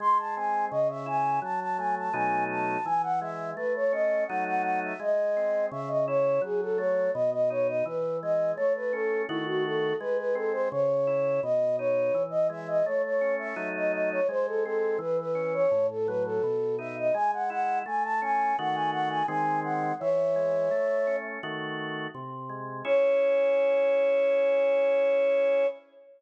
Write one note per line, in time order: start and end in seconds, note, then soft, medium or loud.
0.00 0.68 G#3 loud
0.00 0.18 C6 medium
0.18 0.35 A5 medium
0.36 0.71 C4 medium
0.36 0.65 G#5 medium
0.71 1.40 C#3 loud
0.71 0.88 D#5 medium
0.90 1.07 E5 medium
1.06 1.40 E4 medium
1.06 1.40 G#5 medium
1.42 2.10 F#3 loud
1.42 1.60 A5 medium
1.60 1.77 A5 medium
1.78 2.12 A3 medium
1.78 1.95 G#5 medium
1.98 2.15 A5 medium
2.13 2.78 B2 loud
2.13 2.78 F#3 loud
2.13 2.78 A3 loud
2.13 2.78 D#4 loud
2.13 2.44 G#5 medium
2.50 2.85 A5 medium
2.85 3.53 E3 loud
2.85 3.02 G#5 medium
3.03 3.20 F#5 medium
3.21 3.55 G#3 medium
3.21 3.50 E5 medium
3.56 4.25 A3 loud
3.56 3.73 B4 medium
3.75 3.92 C#5 medium
3.92 4.27 C#4 medium
3.92 4.24 D#5 medium
4.27 4.94 F#3 loud
4.27 4.94 A3 loud
4.27 4.94 D#4 loud
4.27 4.44 F#5 medium
4.46 4.63 F#5 medium
4.63 4.80 F#5 medium
4.84 5.01 E5 medium
5.00 5.67 G#3 loud
5.00 5.66 D#5 medium
5.37 5.71 C4 medium
5.71 6.39 C#3 loud
5.71 5.89 E5 medium
5.88 6.05 D#5 medium
6.08 6.42 E4 medium
6.08 6.41 C#5 medium
6.42 7.09 F#3 loud
6.42 6.61 G#4 medium
6.61 6.78 A4 medium
6.77 7.12 A3 medium
6.77 7.11 C#5 medium
7.13 7.83 B2 loud
7.13 7.30 D#5 medium
7.32 7.49 D#5 medium
7.50 7.84 D#4 medium
7.50 7.67 C#5 medium
7.67 7.84 D#5 medium
7.85 8.53 E3 loud
7.85 8.17 B4 medium
8.22 8.57 G#3 medium
8.22 8.52 D#5 medium
8.56 9.25 A3 loud
8.56 8.73 C#5 medium
8.75 8.92 B4 medium
8.93 9.27 C#4 medium
8.93 9.22 A4 medium
9.28 9.93 D#3 loud
9.28 9.93 A3 loud
9.28 9.45 E4 medium
9.28 9.93 F#4 loud
9.47 9.64 F#4 medium
9.65 9.96 A4 medium
10.00 10.68 G#3 loud
10.00 10.17 B4 medium
10.18 10.35 B4 medium
10.35 10.69 C4 medium
10.35 10.52 A4 medium
10.52 10.69 C5 medium
10.71 11.40 C#3 loud
10.71 11.40 C#5 medium
11.07 11.41 E4 medium
11.43 12.11 B2 loud
11.43 11.76 D#5 medium
11.78 12.13 D#4 medium
11.78 12.23 C#5 medium
12.14 12.82 E3 loud
12.30 12.47 D#5 medium
12.49 12.83 G#3 medium
12.49 12.68 E5 medium
12.68 12.85 D#5 medium
12.85 13.54 A3 loud
12.85 13.02 C#5 medium
13.04 13.35 C#5 medium
13.21 13.55 C#4 medium
13.39 13.69 E5 medium
13.56 14.20 F#3 loud
13.56 14.20 A3 loud
13.56 14.20 D#4 loud
13.76 13.92 D#5 medium
13.93 14.10 D#5 medium
14.11 14.28 C#5 medium
14.29 14.97 G#3 loud
14.29 14.46 C5 medium
14.47 14.64 A4 medium
14.64 14.99 C4 medium
14.64 14.97 A4 medium
14.99 15.66 E3 loud
14.99 15.17 B4 medium
15.19 15.53 B4 medium
15.35 15.69 C#4 medium
15.54 15.87 C#5 medium
15.71 16.39 A2 loud
15.90 16.07 A4 medium
16.06 16.42 F#3 loud
16.06 16.23 B4 medium
16.25 16.76 A4 medium
16.43 17.11 B2 loud
16.79 17.13 D#4 medium
16.79 16.96 E5 medium
16.98 17.15 D#5 medium
17.14 17.82 G#3 loud
17.14 17.31 G#5 medium
17.33 17.50 F#5 medium
17.50 17.84 E4 medium
17.50 17.79 F#5 medium
17.86 18.54 A3 loud
17.86 18.03 G#5 medium
18.04 18.21 A5 medium
18.22 18.56 C#4 medium
18.22 18.56 G#5 medium
18.59 19.23 D#3 loud
18.59 19.23 A3 loud
18.59 19.23 F#4 loud
18.59 18.76 F#5 medium
18.74 18.91 G#5 medium
18.92 19.09 F#5 medium
19.09 19.26 G#5 medium
19.28 19.92 D#3 loud
19.28 19.92 G#3 loud
19.28 19.92 C4 loud
19.28 19.60 G#5 medium
19.64 19.94 F#5 medium
20.00 20.69 E3 loud
20.00 21.16 C#5 medium
20.00 21.16 E5 medium
20.36 20.70 G#3 medium
20.71 21.39 A3 loud
21.07 21.41 C#4 medium
21.43 22.07 D#3 loud
21.43 22.07 A3 loud
21.43 22.07 F#4 loud
22.15 22.82 C3 loud
22.49 22.83 G#3 medium
22.85 25.66 C#4 loud
22.85 25.66 E4 loud
22.85 25.66 G#4 medium
22.85 25.67 C#5 loud